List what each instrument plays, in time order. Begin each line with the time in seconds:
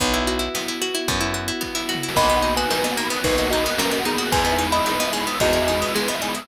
0.00 electric bass (finger) B1, pizzicato strings B3, string ensemble 1 B3 E4 F#4, kick, closed hi-hat
0.14 pizzicato strings E4, closed hi-hat
0.27 pizzicato strings F#4, closed hi-hat
0.39 pizzicato strings E4, closed hi-hat
0.55 pizzicato strings B3, snare
0.68 pizzicato strings E4, closed hi-hat
0.82 pizzicato strings F#4, closed hi-hat
0.94 pizzicato strings E4, closed hi-hat
1.08 electric bass (finger) F#2, pizzicato strings B3, kick, closed hi-hat
1.21 pizzicato strings E4, closed hi-hat
1.34 pizzicato strings F#4, closed hi-hat
1.48 pizzicato strings E4, closed hi-hat
1.61 pizzicato strings B3, kick, snare
1.75 pizzicato strings E4, snare
1.89 pizzicato strings F#4, snare
1.95 floor tom
2.03 pizzicato strings E4
2.09 snare
2.15 electric bass (finger) B1, pizzicato strings A#3, string ensemble 1 A#3 B3 D#4 F#4, vibraphone A#4, kalimba D#5 B5, kick, crash
2.24 vibraphone B4, ride
2.29 pizzicato strings B3, vibraphone D#5, ride
2.36 vibraphone F#5, ride
2.42 pizzicato strings D#4, vibraphone A#5, ride
2.49 vibraphone B5, ride
2.56 pizzicato strings F#4, kalimba B4 G#5, vibraphone D#6, ride
2.62 vibraphone F#6, ride
2.69 pizzicato strings D#4, vibraphone A#4, snare
2.76 vibraphone B4, ride
2.84 pizzicato strings B3, vibraphone D#5, ride
2.91 vibraphone F#5, ride
2.97 pizzicato strings A#3, vibraphone A#5, ride
3.04 vibraphone B5, ride
3.10 pizzicato strings B3, vibraphone D#6, ride
3.18 vibraphone F#6, ride
3.23 electric bass (finger) B1, string ensemble 1 A#3 B3 F#4 A#4, pizzicato strings D#4, kalimba D#4 B4, vibraphone A#4, kick, ride
3.31 vibraphone B4, ride
3.37 pizzicato strings F#4, vibraphone D#5, ride
3.45 vibraphone F#5, ride
3.51 pizzicato strings D#4, kalimba F#4 D#5, vibraphone A#5, ride
3.57 vibraphone B5, ride
3.64 pizzicato strings B3, vibraphone D#6, ride
3.70 vibraphone F#6, ride
3.78 pizzicato strings A#3, kalimba C#4 A#4, vibraphone A#4, snare
3.85 vibraphone B4, ride
3.91 pizzicato strings B3, vibraphone D#5, ride
3.99 vibraphone F#5, ride
4.05 kalimba B3 G#4, pizzicato strings D#4, vibraphone A#5, ride
4.13 vibraphone B5, ride
4.18 pizzicato strings F#4, vibraphone D#6, ride
4.25 vibraphone F#6, ride
4.32 electric bass (finger) E2, string ensemble 1 G#3 B3 D#4 E4, pizzicato strings G#3, vibraphone G#4, kalimba B4 G#5, kick, ride
4.39 vibraphone B4, ride
4.45 pizzicato strings B3, vibraphone D#5, ride
4.52 vibraphone E5, ride
4.58 pizzicato strings D#4, vibraphone G#5, ride
4.66 vibraphone B5, ride
4.72 pizzicato strings E4, kalimba D#5 B5, vibraphone D#6, ride
4.79 vibraphone E6, ride
4.86 pizzicato strings D#4, vibraphone G#4, snare
4.92 vibraphone B4, ride
5.00 pizzicato strings B3, vibraphone D#5, ride
5.06 vibraphone E5, ride
5.13 pizzicato strings G#3, vibraphone G#5, ride
5.20 vibraphone B5, ride
5.27 pizzicato strings B3, vibraphone D#6, ride
5.34 vibraphone E6, ride
5.40 electric bass (finger) E2, string ensemble 1 G#3 B3 E4 G#4, pizzicato strings D#4, kalimba F#4 D#5, vibraphone G#4, kick, ride
5.47 vibraphone B4, ride
5.53 pizzicato strings E4, vibraphone D#5, ride
5.61 vibraphone E5, ride
5.68 pizzicato strings D#4, vibraphone G#5, ride
5.74 vibraphone B5, ride
5.80 pizzicato strings B3, vibraphone D#6, ride
5.87 vibraphone E6, ride
5.94 pizzicato strings G#3, vibraphone G#4, snare
6.01 vibraphone B4, ride
6.08 pizzicato strings B3, vibraphone D#5, ride
6.15 vibraphone E5, ride
6.22 pizzicato strings D#4, vibraphone G#5, ride
6.28 vibraphone B5, ride
6.35 pizzicato strings E4, vibraphone D#6, ride
6.41 vibraphone E6, ride